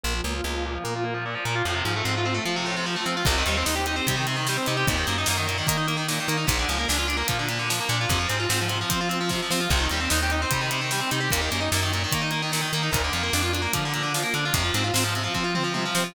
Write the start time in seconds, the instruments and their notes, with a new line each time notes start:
0.03 electric bass (finger) A#1, overdriven guitar A#2
0.14 overdriven guitar F3
0.24 electric bass (finger) C#2, overdriven guitar A#3
0.34 overdriven guitar F4
0.44 electric bass (finger) C#2, overdriven guitar A#3
0.54 overdriven guitar F3
0.66 overdriven guitar A#2
0.75 overdriven guitar F3
0.84 electric bass (finger) A#2, overdriven guitar A#3
0.96 overdriven guitar F4
1.04 overdriven guitar A#3
1.14 overdriven guitar F3
1.26 overdriven guitar A#2
1.35 overdriven guitar F3
1.45 electric bass (finger) A#2, overdriven guitar A#3
1.55 overdriven guitar F4
1.65 electric bass (finger) F2, overdriven guitar A2
1.75 overdriven guitar C3
1.84 electric bass (finger) G#2, overdriven guitar F3
1.96 overdriven guitar A3
2.04 electric bass (finger) G#2, overdriven guitar C4
2.17 overdriven guitar F4
2.25 overdriven guitar C4
2.34 overdriven guitar A3
2.45 electric bass (finger) F3, overdriven guitar F3
2.56 overdriven guitar C3
2.66 overdriven guitar A2
2.76 overdriven guitar C3
2.86 overdriven guitar F3
2.96 overdriven guitar A3
3.06 electric bass (finger) F3, overdriven guitar C4
3.17 overdriven guitar F4
3.25 electric bass (finger) C2, overdriven guitar C3, kick, crash
3.38 overdriven guitar D#3
3.46 electric bass (finger) D#2, overdriven guitar G3, closed hi-hat
3.57 overdriven guitar C4
3.66 electric bass (finger) D#2, overdriven guitar D#4, snare
3.76 overdriven guitar G4
3.86 overdriven guitar D#4, closed hi-hat
3.96 overdriven guitar C4
4.07 electric bass (finger) C3, overdriven guitar G3, kick, closed hi-hat
4.16 overdriven guitar D#3
4.27 overdriven guitar C3, closed hi-hat
4.36 overdriven guitar D#3
4.47 overdriven guitar G3, snare
4.57 overdriven guitar C4
4.66 electric bass (finger) C3, overdriven guitar D#4, closed hi-hat
4.77 overdriven guitar G4
4.87 electric bass (finger) D#2, overdriven guitar A#2, kick, closed hi-hat
4.97 overdriven guitar D#3
5.07 electric bass (finger) F#2, overdriven guitar A#3, closed hi-hat
5.18 overdriven guitar D#4
5.26 electric bass (finger) F#2, overdriven guitar A#3, snare
5.37 overdriven guitar D#3
5.47 overdriven guitar A#2, closed hi-hat
5.58 overdriven guitar D#3
5.67 electric bass (finger) D#3, overdriven guitar A#3, kick, closed hi-hat
5.77 overdriven guitar D#4
5.88 overdriven guitar A#3, closed hi-hat
5.97 overdriven guitar D#3
6.08 overdriven guitar A#2, snare
6.20 overdriven guitar D#3
6.28 electric bass (finger) D#3, overdriven guitar A#3, closed hi-hat
6.37 overdriven guitar D#4
6.47 electric bass (finger) A#1, overdriven guitar A#2, kick, closed hi-hat
6.59 overdriven guitar D3
6.69 electric bass (finger) C#2, overdriven guitar F3, closed hi-hat
6.78 overdriven guitar A#3
6.88 electric bass (finger) C#2, overdriven guitar D4, snare
6.98 overdriven guitar F4
7.08 overdriven guitar D4, closed hi-hat
7.17 overdriven guitar A#3
7.28 electric bass (finger) A#2, overdriven guitar F3, kick, closed hi-hat
7.39 overdriven guitar D3
7.49 overdriven guitar A#2, closed hi-hat
7.59 overdriven guitar D3
7.70 overdriven guitar F3, snare
7.80 overdriven guitar A#3
7.89 electric bass (finger) A#2, overdriven guitar D4, closed hi-hat
8.01 overdriven guitar F4
8.09 electric bass (finger) F2, overdriven guitar C3, kick, closed hi-hat
8.19 overdriven guitar F3
8.29 electric bass (finger) G#2, overdriven guitar C4, closed hi-hat
8.40 overdriven guitar F4
8.49 electric bass (finger) G#2, overdriven guitar C4, snare
8.61 overdriven guitar F3
8.68 overdriven guitar C3, closed hi-hat
8.81 overdriven guitar F3
8.90 electric bass (finger) F3, overdriven guitar C4, kick, closed hi-hat
9.01 overdriven guitar F4
9.09 overdriven guitar C4, closed hi-hat
9.21 overdriven guitar F3
9.29 overdriven guitar C3, kick, snare
9.42 overdriven guitar F3
9.51 electric bass (finger) F3, overdriven guitar C4, snare
9.61 overdriven guitar F4
9.70 electric bass (finger) C2, overdriven guitar C3, kick, crash
9.80 overdriven guitar D#3
9.89 electric bass (finger) D#2, overdriven guitar G3, closed hi-hat
10.00 overdriven guitar C4
10.10 electric bass (finger) D#2, overdriven guitar D#4, snare
10.23 overdriven guitar G4
10.30 overdriven guitar D#4, closed hi-hat
10.42 overdriven guitar C4
10.51 electric bass (finger) C3, overdriven guitar G3, kick, closed hi-hat
10.61 overdriven guitar D#3
10.71 overdriven guitar C3, closed hi-hat
10.81 overdriven guitar D#3
10.91 overdriven guitar G3, snare
11.01 overdriven guitar C4
11.11 electric bass (finger) C3, overdriven guitar D#4, closed hi-hat
11.20 overdriven guitar G4
11.30 electric bass (finger) D#2, overdriven guitar A#2, kick, closed hi-hat
11.41 overdriven guitar D#3
11.51 electric bass (finger) F#2, overdriven guitar A#3, closed hi-hat
11.60 overdriven guitar D#4
11.72 electric bass (finger) F#2, overdriven guitar A#3, snare
11.82 overdriven guitar D#3
11.93 overdriven guitar A#2, closed hi-hat
12.04 overdriven guitar D#3
12.12 electric bass (finger) D#3, overdriven guitar A#3, kick, closed hi-hat
12.22 overdriven guitar D#4
12.31 overdriven guitar A#3, closed hi-hat
12.42 overdriven guitar D#3
12.52 overdriven guitar A#2, snare
12.61 overdriven guitar D#3
12.73 electric bass (finger) D#3, overdriven guitar A#3, closed hi-hat
12.83 overdriven guitar D#4
12.91 electric bass (finger) D2, overdriven guitar A#2, kick, closed hi-hat
13.04 overdriven guitar D3
13.13 electric bass (finger) F2, overdriven guitar F3, closed hi-hat
13.23 overdriven guitar A#3
13.33 electric bass (finger) F2, overdriven guitar D4, snare
13.42 overdriven guitar F4
13.53 overdriven guitar D4, closed hi-hat
13.62 overdriven guitar A#3
13.73 electric bass (finger) D3, overdriven guitar F3, kick, closed hi-hat
13.85 overdriven guitar D3
13.93 overdriven guitar A#2, closed hi-hat
14.03 overdriven guitar D3
14.14 overdriven guitar F3, snare
14.23 overdriven guitar A#3
14.34 electric bass (finger) D3, overdriven guitar D4, closed hi-hat
14.45 overdriven guitar F4
14.54 electric bass (finger) F2, overdriven guitar C3, kick, closed hi-hat
14.64 overdriven guitar F3
14.74 electric bass (finger) G#2, overdriven guitar C4, closed hi-hat
14.84 overdriven guitar F4
14.94 electric bass (finger) G#2, overdriven guitar C4, snare
15.04 overdriven guitar F3
15.15 overdriven guitar C3, closed hi-hat
15.24 overdriven guitar F3
15.34 electric bass (finger) F3, overdriven guitar C4, kick
15.44 overdriven guitar F4
15.55 overdriven guitar C4, mid tom
15.64 overdriven guitar F3
15.74 overdriven guitar C3, high tom
15.85 overdriven guitar F3
15.95 electric bass (finger) F3, overdriven guitar C4, snare
16.04 overdriven guitar F4